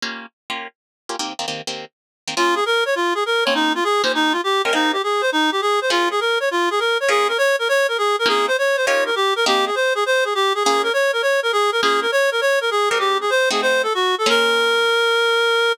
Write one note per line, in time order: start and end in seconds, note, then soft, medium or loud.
0.02 0.26 A#3 medium
0.02 0.26 C#4 medium
0.02 0.26 F4 medium
0.02 0.26 G4 medium
0.50 0.67 A#3 medium
0.50 0.67 C#4 medium
0.50 0.67 F4 medium
0.50 0.67 G4 medium
1.09 1.16 A#3 medium
1.09 1.16 C#4 medium
1.09 1.16 F4 medium
1.09 1.16 G4 medium
1.19 1.33 D#3 medium
1.19 1.33 A#3 medium
1.19 1.33 C4 medium
1.19 1.33 G4 medium
1.39 1.46 D#3 medium
1.39 1.46 A#3 medium
1.39 1.46 C4 medium
1.39 1.46 G4 medium
1.48 1.62 D#3 medium
1.48 1.62 A#3 medium
1.48 1.62 C4 medium
1.48 1.62 G4 medium
1.67 1.85 D#3 medium
1.67 1.85 A#3 medium
1.67 1.85 C4 medium
1.67 1.85 G4 medium
2.28 2.34 D#3 medium
2.28 2.34 A#3 medium
2.28 2.34 C4 medium
2.28 2.34 G4 medium
2.37 2.61 A#3 medium
2.37 2.61 C#4 medium
2.37 2.55 F4 medium
2.37 2.61 F4 medium
2.37 2.61 G#4 medium
2.55 2.64 G#4 medium
2.66 2.84 A#4 medium
2.86 2.95 C#5 medium
2.95 3.14 F4 medium
3.15 3.24 G#4 medium
3.26 3.44 A#4 medium
3.45 3.80 A#3 medium
3.45 3.80 C4 medium
3.45 3.80 C#4 medium
3.45 3.80 D#4 medium
3.45 3.80 F4 medium
3.45 3.54 C#5 medium
3.55 3.73 D#4 medium
3.75 3.84 F4 medium
3.84 4.02 G#4 medium
4.03 4.37 A#3 medium
4.03 4.37 C#4 medium
4.03 4.37 D#4 medium
4.03 4.37 F4 medium
4.03 4.37 G4 medium
4.03 4.12 C5 medium
4.15 4.33 D#4 medium
4.32 4.41 F4 medium
4.44 4.62 G4 medium
4.64 4.72 A#3 medium
4.64 4.72 C#4 medium
4.64 4.72 D#4 medium
4.64 4.72 F4 medium
4.64 4.72 G4 medium
4.64 4.73 A#4 medium
4.73 4.96 A#3 medium
4.73 4.96 C4 medium
4.73 4.96 D#4 medium
4.73 4.92 D#4 medium
4.73 4.96 G4 medium
4.73 4.96 G#4 medium
4.93 5.02 G4 medium
5.04 5.22 G#4 medium
5.21 5.30 C5 medium
5.32 5.50 D#4 medium
5.52 5.61 G4 medium
5.62 5.80 G#4 medium
5.81 5.90 C5 medium
5.90 6.14 A#3 medium
5.90 6.14 C#4 medium
5.90 6.14 F4 medium
5.90 6.09 F4 medium
5.90 6.14 G#4 medium
6.11 6.20 G#4 medium
6.20 6.38 A#4 medium
6.40 6.49 C#5 medium
6.51 6.69 F4 medium
6.71 6.80 G#4 medium
6.80 6.98 A#4 medium
7.00 7.09 C#5 medium
7.08 7.32 A#3 medium
7.08 7.32 C#4 loud
7.08 7.32 F4 medium
7.08 7.32 G#4 medium
7.08 7.27 G#4 medium
7.28 7.37 A#4 medium
7.38 7.56 C#5 medium
7.59 7.68 A#4 medium
7.69 7.87 C#5 medium
7.88 7.97 A#4 medium
7.98 8.16 G#4 medium
8.19 8.28 A#4 medium
8.26 8.49 A#3 medium
8.26 8.49 C4 medium
8.26 8.49 C#4 medium
8.26 8.49 D#4 loud
8.26 8.49 F4 loud
8.26 8.46 G#4 medium
8.48 8.57 C5 medium
8.58 8.76 C#5 medium
8.77 8.86 C5 medium
8.86 9.11 A#3 loud
8.86 9.11 C#4 loud
8.86 9.11 D#4 loud
8.86 9.11 F4 medium
8.86 9.11 G4 medium
8.86 9.04 C#5 medium
9.06 9.15 A#4 medium
9.16 9.34 G4 medium
9.36 9.45 A#4 medium
9.46 9.70 A#3 loud
9.46 9.70 C4 loud
9.46 9.70 D#4 medium
9.46 9.70 G4 loud
9.46 9.65 G4 medium
9.46 9.70 G#4 loud
9.66 9.75 G#4 medium
9.75 9.93 C5 medium
9.95 10.04 G#4 medium
10.06 10.24 C5 medium
10.25 10.34 G#4 medium
10.35 10.53 G4 medium
10.55 10.63 G#4 medium
10.64 10.90 A#3 loud
10.64 10.90 C#4 medium
10.64 10.90 F4 medium
10.64 10.82 G#4 medium
10.64 10.90 G#4 loud
10.83 10.92 A#4 medium
10.93 11.11 C#5 medium
11.13 11.22 A#4 medium
11.22 11.40 C#5 medium
11.43 11.52 A#4 medium
11.52 11.71 G#4 medium
11.72 11.81 A#4 medium
11.82 12.06 A#3 loud
11.82 12.06 C#4 medium
11.82 12.06 F4 loud
11.82 12.00 G#4 medium
11.82 12.06 G#4 medium
12.02 12.11 A#4 medium
12.12 12.30 C#5 medium
12.32 12.41 A#4 medium
12.41 12.59 C#5 medium
12.61 12.70 A#4 medium
12.71 12.89 G#4 medium
12.89 13.25 G#3 medium
12.89 13.25 C4 medium
12.89 13.25 D#4 medium
12.89 13.25 G4 medium
12.89 12.98 A#4 medium
12.99 13.18 G4 medium
13.21 13.30 G#4 medium
13.30 13.49 C5 medium
13.50 13.87 A3 medium
13.50 13.87 C4 loud
13.50 13.87 D#4 medium
13.50 13.87 F#4 loud
13.50 13.61 G#4 medium
13.62 13.82 C5 medium
13.83 13.93 A4 medium
13.94 14.15 F#4 medium
14.18 14.29 A4 medium
14.26 15.69 A#3 loud
14.26 15.69 C#4 loud
14.26 15.69 F4 loud
14.26 15.69 G#4 medium
14.26 15.72 A#4 loud